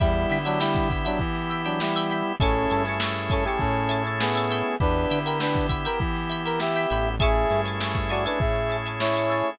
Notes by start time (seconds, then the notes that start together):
0.00 E2 G3 B3 E4 G4 E5 G5 B5, kick, closed hi-hat
0.15 closed hi-hat
0.30 D3 E5 G5 B5, closed hi-hat
0.45 F#3 D4 E5 G5 B5, closed hi-hat
0.59 G3 E4 E5 G5 B5, snare
0.75 kick, snare, closed hi-hat
0.90 E5 G5 B5, kick, snare, closed hi-hat
1.05 F#3 D4 E5 G5 B5, closed hi-hat
1.19 E3, kick, closed hi-hat
1.35 snare, closed hi-hat
1.50 E5 G5 B5, closed hi-hat
1.65 F#3 D4 E5 G5 B5, closed hi-hat
1.80 G3 E4, snare
1.95 E5 G5 B5, closed hi-hat
2.10 E5 G5 B5, closed hi-hat
2.25 closed hi-hat
2.40 A1 A3 C#4 E4 G#4 A4 E5 G#5 A5 C#6, kick, closed hi-hat
2.55 closed hi-hat
2.70 G2 E5 G#5 A5 C#6, closed hi-hat
2.84 E5 G#5 A5, snare, closed hi-hat
2.89 C#6
3.00 E5 G#5 A5 C#6, snare
3.15 snare, closed hi-hat
3.30 C#4 A4 E5 G#5 A5 C#6, kick, closed hi-hat
3.45 G4 E5 G#5 A5 C#6, closed hi-hat
3.59 A2 C#4 A4, kick, closed hi-hat
3.75 closed hi-hat
3.89 E5 G#5 A5 C#6, closed hi-hat
4.04 E5 G#5 A5 C#6, closed hi-hat
4.20 B3 G#4, snare
4.35 E5 G#5 A5 C#6, closed hi-hat
4.51 E5 G5 B5, closed hi-hat
4.65 closed hi-hat
4.80 E2 B3 D4 E4 G4 B4, kick, closed hi-hat
4.95 closed hi-hat
5.10 D3 E5 G5 B5, closed hi-hat
5.25 A#4 E5 G5 B5, closed hi-hat
5.40 D4 B4 E5 G5 B5, snare
5.55 kick, snare, closed hi-hat
5.69 E5 G5 B5, kick, closed hi-hat
5.85 A#4 E5 G5 B5, closed hi-hat
6.00 E3, kick, closed hi-hat
6.15 snare, closed hi-hat
6.30 E5 G5 B5, closed hi-hat
6.45 A#4 E5 G5 B5, closed hi-hat
6.59 G4 E5, snare
6.75 E5 G5 B5, closed hi-hat
6.90 A1 E5 G5 B5, closed hi-hat
7.04 closed hi-hat
7.19 A3 C#4 E4 G#4 E5 G#5 A5 C#6, kick, closed hi-hat
7.35 closed hi-hat
7.50 G2 E5 G#5 A5 C#6, closed hi-hat
7.65 E5 G#5 A5 C#6, closed hi-hat
7.81 E5 G#5 A5 C#6, snare
7.95 kick, snare, closed hi-hat
8.09 F#4 D5 E5 G#5 A5 C#6, closed hi-hat
8.25 D4 B4 E5 G#5 A5 C#6, closed hi-hat
8.40 A2 G#4 E5, kick, closed hi-hat
8.56 closed hi-hat
8.70 E5 G#5 A5 C#6, closed hi-hat
8.85 E5 G#5 A5 C#6, closed hi-hat
9.00 E4 C#5, snare
9.14 E5 G#5 A5, closed hi-hat
9.19 C#6
9.30 E5 G#5 A5 C#6, snare, closed hi-hat
9.45 closed hi-hat